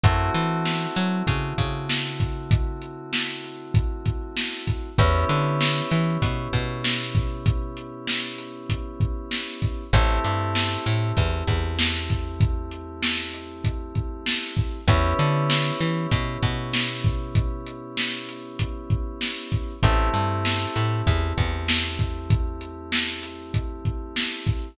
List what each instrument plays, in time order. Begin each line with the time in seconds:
0.03 electric bass (finger) F#2, electric piano 2 A3 C4 E4 F#4, kick, closed hi-hat
0.35 electric bass (finger) E3, closed hi-hat
0.65 snare
0.96 electric bass (finger) F#3, closed hi-hat
1.27 electric bass (finger) C#3, kick, closed hi-hat
1.58 electric bass (finger) C#3, kick, closed hi-hat
1.89 snare
2.20 kick, closed hi-hat
2.51 kick, closed hi-hat
2.82 closed hi-hat
3.13 snare
3.44 closed hi-hat
3.74 kick, closed hi-hat
4.06 kick, closed hi-hat
4.37 snare
4.67 kick, closed hi-hat
4.98 electric bass (finger) E2, electric piano 2 B3 C#4 E4 G4, kick, closed hi-hat
5.29 electric bass (finger) D3, closed hi-hat
5.61 snare
5.91 electric bass (finger) E3, closed hi-hat
6.22 electric bass (finger) B2, kick, closed hi-hat
6.53 electric bass (finger) B2, kick, closed hi-hat
6.84 snare
7.15 kick, closed hi-hat
7.46 kick, closed hi-hat
7.77 closed hi-hat
8.07 snare
8.38 closed hi-hat
8.70 kick, closed hi-hat
9.00 kick, closed hi-hat
9.31 snare
9.62 kick, closed hi-hat
9.93 electric bass (finger) A1, electric piano 2 A3 C4 E4 G4, kick, closed hi-hat
10.24 electric bass (finger) G2, closed hi-hat
10.55 snare
10.86 electric bass (finger) A2, closed hi-hat
11.17 electric bass (finger) E2, kick, closed hi-hat
11.48 electric bass (finger) E2, kick, closed hi-hat
11.79 snare
12.10 kick, closed hi-hat
12.40 kick, closed hi-hat
12.71 closed hi-hat
13.02 snare
13.33 closed hi-hat
13.64 kick, closed hi-hat
13.95 kick, closed hi-hat
14.26 snare
14.57 kick, closed hi-hat
14.88 electric bass (finger) E2, electric piano 2 B3 C#4 E4 G4, kick, closed hi-hat
15.19 electric bass (finger) D3, closed hi-hat
15.50 snare
15.81 electric bass (finger) E3, closed hi-hat
16.11 electric bass (finger) B2, kick, closed hi-hat
16.43 electric bass (finger) B2, kick, closed hi-hat
16.73 snare
17.05 kick, closed hi-hat
17.35 kick, closed hi-hat
17.66 closed hi-hat
17.97 snare
18.29 closed hi-hat
18.59 kick, closed hi-hat
18.90 kick, closed hi-hat
19.21 snare
19.52 kick, closed hi-hat
19.83 electric bass (finger) A1, electric piano 2 A3 C4 E4 G4, kick, closed hi-hat
20.14 electric bass (finger) G2, closed hi-hat
20.45 snare
20.76 electric bass (finger) A2, closed hi-hat
21.07 electric bass (finger) E2, kick, closed hi-hat
21.38 electric bass (finger) E2, kick, closed hi-hat
21.68 snare
21.99 kick, closed hi-hat
22.30 kick, closed hi-hat
22.61 closed hi-hat
22.92 snare
23.23 closed hi-hat
23.54 kick, closed hi-hat
23.85 kick, closed hi-hat
24.16 snare
24.47 kick, closed hi-hat